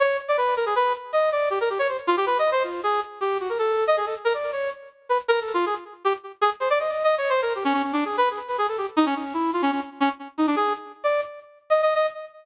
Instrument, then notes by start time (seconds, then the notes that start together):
brass section
0.00 C#5
0.28 D5
0.37 B4
0.57 A#4
0.66 G#4
0.76 B4
1.13 D#5
1.32 D5
1.50 G4
1.61 A#4
1.70 G4
1.79 C#5
1.88 C5
2.07 F4
2.17 G4
2.26 B4
2.39 D#5
2.52 C5
2.64 F4
2.83 G#4
3.21 G4
3.40 F#4
3.49 A#4
3.59 A4
3.87 D#5
3.97 G#4
4.06 A4
4.25 A#4
4.34 D5
4.52 C#5
5.09 B4
5.28 A#4
5.41 A4
5.54 F4
5.66 G#4
6.05 G4
6.41 G#4
6.60 C5
6.70 D5
6.79 D#5
6.92 D#5
7.04 D#5
7.18 C#5
7.29 C5
7.42 A#4
7.55 G4
7.65 C#4
7.74 C#4
7.83 C#4
7.93 D4
8.05 G#4
8.17 B4
8.31 G#4
8.48 B4
8.58 G#4
8.68 A4
8.78 G4
8.97 D#4
9.06 C#4
9.16 C#4
9.34 E4
9.53 F4
9.62 C#4
9.72 C#4
10.00 C#4
10.38 D#4
10.47 D4
10.56 G#4
11.04 D5
11.70 D#5
11.82 D#5
11.95 D#5